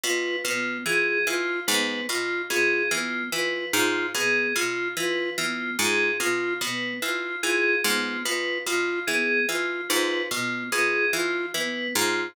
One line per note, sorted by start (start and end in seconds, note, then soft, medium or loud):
0.04 0.36 B2 medium
0.04 0.36 F4 medium
0.04 0.36 B4 medium
0.44 0.78 B2 medium
0.44 0.79 B3 medium
0.44 0.77 F4 medium
0.86 1.19 E3 medium
0.86 1.18 F4 medium
0.86 1.19 G#4 medium
1.27 1.60 E3 medium
1.27 1.60 F4 medium
1.67 2.01 G#2 medium
1.67 2.01 B3 medium
1.67 2.00 B4 medium
2.09 2.42 B2 medium
2.09 2.42 F4 medium
2.09 2.43 F4 medium
2.50 2.83 B2 medium
2.50 2.83 F4 medium
2.50 2.83 G#4 medium
2.91 3.24 E3 medium
2.91 3.23 B3 medium
2.91 3.24 F4 medium
3.32 3.65 E3 medium
3.32 3.66 F4 medium
3.32 3.65 B4 medium
3.73 4.06 G#2 medium
3.73 4.06 F4 medium
3.73 4.07 F4 medium
4.15 4.47 B2 medium
4.15 4.47 B3 medium
4.15 4.48 G#4 medium
4.55 4.89 B2 medium
4.55 4.88 F4 medium
4.55 4.89 F4 medium
4.97 5.30 E3 medium
4.97 5.30 F4 medium
4.97 5.30 B4 medium
5.38 5.71 E3 medium
5.38 5.71 B3 medium
5.38 5.71 F4 medium
5.78 6.12 G#2 medium
5.78 6.11 F4 medium
5.78 6.12 G#4 medium
6.20 6.53 B2 medium
6.20 6.53 F4 medium
6.20 6.54 F4 medium
6.61 6.94 B2 medium
6.61 6.93 B3 medium
6.61 6.94 B4 medium
7.02 7.35 E3 medium
7.02 7.35 F4 medium
7.02 7.36 F4 medium
7.42 7.76 E3 medium
7.42 7.75 F4 medium
7.42 7.76 G#4 medium
7.84 8.17 G#2 medium
7.84 8.17 B3 medium
7.84 8.18 F4 medium
8.25 8.58 B2 medium
8.25 8.58 F4 medium
8.25 8.58 B4 medium
8.67 8.99 B2 medium
8.67 9.00 F4 medium
9.07 9.41 E3 medium
9.07 9.40 B3 medium
9.07 9.40 G#4 medium
9.48 9.82 E3 medium
9.48 9.81 F4 medium
9.48 9.82 F4 medium
9.89 10.23 G#2 medium
9.89 10.22 F4 medium
9.89 10.22 B4 medium
10.31 10.64 B2 medium
10.31 10.64 B3 medium
10.31 10.64 F4 medium
10.72 11.05 B2 medium
10.72 11.06 F4 medium
10.72 11.05 G#4 medium
11.13 11.46 E3 medium
11.13 11.46 F4 medium
11.54 11.87 E3 medium
11.54 11.88 B3 medium
11.54 11.87 B4 medium
11.95 12.28 G#2 medium
11.95 12.28 F4 medium